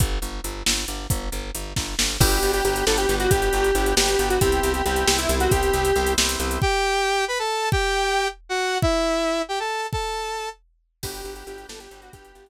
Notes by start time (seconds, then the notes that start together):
0.00 G1, kick, closed hi-hat
0.22 G1, closed hi-hat
0.44 G1, closed hi-hat
0.66 G1, snare
0.88 G1, closed hi-hat
1.10 G1, kick, closed hi-hat
1.32 G1, closed hi-hat
1.55 G1, closed hi-hat
1.76 G1, kick, snare
1.99 G1, snare
2.20 G1 B3 D4 F#4 G4, kick, crash
2.32 closed hi-hat
2.43 G1, closed hi-hat
2.53 G4, closed hi-hat
2.64 G1 B3 D4 F#4 G4, closed hi-hat
2.76 closed hi-hat
2.86 G1 B3 D4 F#4 G4 A4, snare
2.97 G4, closed hi-hat
3.09 G1 B3 D4 F#4 G4, closed hi-hat
3.20 F#4, closed hi-hat
3.31 G1 G4, kick, closed hi-hat
3.42 closed hi-hat
3.53 G1, closed hi-hat
3.64 closed hi-hat
3.75 G1 B3 D4 F#4 G4, closed hi-hat
3.86 closed hi-hat
3.97 G1 B3 D4 F#4 G4, snare
4.08 closed hi-hat
4.19 G1 B3 D4 F#4 G4, closed hi-hat
4.30 F#4, closed hi-hat
4.41 C2 B3 C4 E4 G4, kick, closed hi-hat
4.52 closed hi-hat
4.63 C2, closed hi-hat
4.74 G4, closed hi-hat
4.85 C2 B3 C4 E4 G4, closed hi-hat
4.96 closed hi-hat
5.07 C2 B3 C4 E4 G4, snare
5.18 E4, closed hi-hat
5.29 C2 B3 C4 E4 G4, closed hi-hat
5.40 F#4, closed hi-hat
5.51 C2 G4, kick, closed hi-hat
5.63 closed hi-hat
5.73 C2, closed hi-hat
5.85 closed hi-hat
5.96 C2 B3 C4 E4 G4, closed hi-hat
6.07 closed hi-hat
6.18 C2 B3 C4 E4 G4, snare
6.29 closed hi-hat
6.40 C2 B3 C4 E4 G4, closed hi-hat
6.51 closed hi-hat
6.62 G4 G5, kick
7.28 B4 B5
7.39 A4 A5
7.72 G4 G5, kick
8.49 F#4 F#5
8.82 E4 E5, kick
9.49 G4 G5
9.60 A4 A5
9.93 A4 A5, kick
11.03 G1 B3 D4 F#4 G4, kick, crash
11.14 closed hi-hat
11.25 G1, closed hi-hat
11.36 G4, closed hi-hat
11.47 G1 B3 D4 F#4 G4, closed hi-hat
11.58 closed hi-hat
11.68 G1 B3 D4 F#4 G4 A4, snare
11.80 G4, closed hi-hat
11.91 G1 B3 D4 F#4 G4, closed hi-hat
12.02 F#4, closed hi-hat
12.13 G1 G4, kick, closed hi-hat
12.25 closed hi-hat
12.35 G1, closed hi-hat
12.46 closed hi-hat